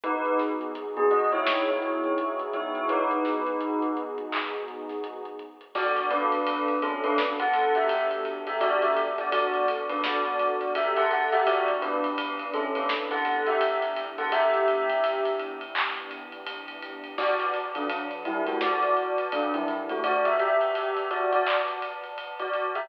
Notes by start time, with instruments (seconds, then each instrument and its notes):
0.03 synth bass 2 G#1, pad 2 (warm) B3 D#4 F#4 G#4, tubular bells D#4 B4, kick, closed hi-hat
0.25 closed hi-hat
0.39 synth bass 2 G#1, snare, closed hi-hat
0.61 closed hi-hat
0.75 synth bass 2 G#1, closed hi-hat
0.97 tubular bells B3 G#4, closed hi-hat
1.11 tubular bells F#4 D#5, closed hi-hat
1.32 tubular bells E4 C#5, closed hi-hat
1.46 synth bass 2 G#1, snare
1.68 tubular bells E4 C#5, closed hi-hat
1.82 closed hi-hat
2.04 closed hi-hat
2.18 closed hi-hat
2.39 closed hi-hat
2.53 synth bass 2 G#2, tubular bells E4 C#5, closed hi-hat
2.75 closed hi-hat
2.89 tubular bells D#4 B4, kick, closed hi-hat
3.11 closed hi-hat
3.25 snare, closed hi-hat
3.46 closed hi-hat
3.60 closed hi-hat
3.82 closed hi-hat
3.97 closed hi-hat
4.18 kick, closed hi-hat
4.32 clap
4.53 closed hi-hat
4.68 closed hi-hat
4.89 snare, closed hi-hat
5.04 closed hi-hat
5.25 closed hi-hat
5.39 kick, closed hi-hat
5.61 closed hi-hat
5.75 pad 2 (warm) B3 D4 F#4 A4, tubular bells F#4 D5, kick, crash
5.97 ride
6.10 tubular bells D4 B4, ride
6.32 ride
6.46 ride
6.68 ride
6.82 tubular bells C#4 A4, ride
7.04 tubular bells D4 B4, ride
7.18 snare
7.39 tubular bells A4 F#5, kick, ride
7.53 ride
7.75 tubular bells G4 E5, ride
7.89 ride
8.11 ride
8.25 ride
8.47 tubular bells G4 E5, ride
8.61 tubular bells F#4 D5, kick, ride
8.82 tubular bells G4 E5, ride
8.96 ride
9.18 tubular bells F#4 D5, kick, ride
9.32 tubular bells F#4 D5, ride
9.54 ride
9.68 ride
9.89 tubular bells D4 B4, ride
10.03 tubular bells F#4 D5, snare
10.25 ride
10.39 ride
10.61 ride
10.75 tubular bells G4 E5, ride
10.96 tubular bells A4 F#5, ride
11.11 tubular bells A4 F#5, ride
11.32 tubular bells G4 E5, snare, ride
11.46 pad 2 (warm) E3 B3 D4 G4, tubular bells F#4 D5, kick, ride
11.68 ride
11.82 tubular bells D4 B4, ride
12.04 ride
12.18 pad 2 (warm) E3 B3 D4 G4, ride
12.39 ride
12.53 tubular bells C#4 A4, ride
12.75 tubular bells D4 B4, ride
12.89 pad 2 (warm) E3 B3 D4 G4, snare
13.11 tubular bells A4 F#5, kick, ride
13.25 ride
13.46 tubular bells G4 E5, ride
13.61 pad 2 (warm) E3 B3 D4 G4, ride
13.82 ride
13.96 ride
14.18 tubular bells A4 F#5, ride
14.32 pad 2 (warm) E3 B3 D4 G4, tubular bells G4 E5, kick, ride
14.54 ride
14.68 ride
14.89 kick, ride
15.03 pad 2 (warm) E3 B3 D4 G4, ride
15.25 ride
15.39 ride
15.61 ride
15.75 pad 2 (warm) E3 B3 D4 G4, clap
15.97 ride
16.11 ride
16.32 ride
16.46 pad 2 (warm) E3 B3 D4 G4, ride
16.68 ride
16.82 ride
17.04 ride
17.18 tubular bells F#4 D5, pad 2 (warm) B4 D5 F#5 A5, kick, crash
17.40 ride
17.54 ride
17.75 tubular bells F#3 D4, ride
17.89 ride
18.11 ride
18.25 tubular bells G3 E4, ride
18.46 tubular bells A3 F#4, ride
18.61 tubular bells F#4 D5, snare
18.82 kick, ride
18.97 ride
19.18 ride
19.32 tubular bells F#3 D4, ride
19.54 tubular bells G3 E4, ride
19.68 ride
19.89 tubular bells A3 F#4, ride
20.03 tubular bells F#4 D5, pad 2 (warm) B4 D5 F#5 A5, kick, ride
20.25 tubular bells G4 E5, ride
20.39 tubular bells G4 E5, ride
20.61 ride
20.75 ride
20.97 ride
21.11 tubular bells F#4 D5, ride
21.32 tubular bells F#4 D5, ride
21.46 clap
21.68 ride
21.82 ride
22.04 ride
22.18 ride
22.39 tubular bells F#4 D5, ride
22.53 ride
22.75 tubular bells G4 E5, ride